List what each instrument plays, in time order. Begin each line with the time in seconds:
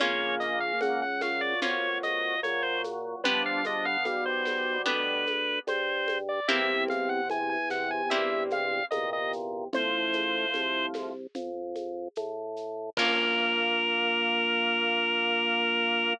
0.00 drawbar organ A#1 C#3 A#3 C#5, orchestral harp A#3 C#4 F4, low conga, shaker
0.40 drawbar organ D#5, shaker
0.60 drawbar organ F5
0.81 drawbar organ C#2 F#5, high conga, shaker
1.02 drawbar organ F#5
1.21 drawbar organ A#2 F#3 F5, snare, high conga, shaker
1.41 drawbar organ D5
1.62 drawbar organ F2 C#5, orchestral harp A#3 C#4 F4, low conga, shaker
2.03 drawbar organ D#5, high conga, shaker
2.43 drawbar organ A#2 F#3 C#5, high conga, shaker
2.63 drawbar organ C5
2.84 high conga, shaker
3.24 drawbar organ G1 F3 D4 B4, orchestral harp B3 D4 G4, low conga, shaker
3.46 drawbar organ F5
3.65 drawbar organ F3 D4 D#5, high conga, shaker
3.85 drawbar organ D3 B3 F5
4.05 drawbar organ B1 B2 G3 F5, high conga, shaker
4.26 drawbar organ C5
4.45 snare, high conga, shaker
4.86 drawbar organ D2 B4, orchestral harp B3 D4 G4, low conga, shaker
5.27 high conga, shaker
5.67 drawbar organ G2 C5, high conga, shaker
6.08 high conga, shaker
6.29 drawbar organ D5
6.48 drawbar organ C2 E2 C3 E5, orchestral harp A#3 C4 E4 G4, low conga, shaker
6.88 drawbar organ F5, high conga, shaker
7.09 drawbar organ F#5
7.30 drawbar organ E2 G#5, high conga, shaker
7.49 drawbar organ G#5
7.69 drawbar organ E2 C3 F#5, snare, shaker
7.91 drawbar organ G#5
8.10 drawbar organ G2 E5, orchestral harp A#3 C4 E4 G4, low conga, shaker
8.50 drawbar organ F5, high conga, shaker
8.91 drawbar organ E2 A#2 C3 D#5, high conga, shaker
9.13 drawbar organ D#5
9.33 shaker
9.73 drawbar organ A1 A2 F3 C5, low conga, shaker
10.13 high conga, shaker
10.54 drawbar organ C2, high conga, shaker
10.94 snare, high conga, shaker
11.35 drawbar organ F2, low conga, shaker
11.76 high conga, shaker
12.16 drawbar organ A2, high conga, shaker
12.56 shaker
12.97 drawbar organ A#1 A#3 A#4, orchestral harp A#3 C#4 F4, kick, crash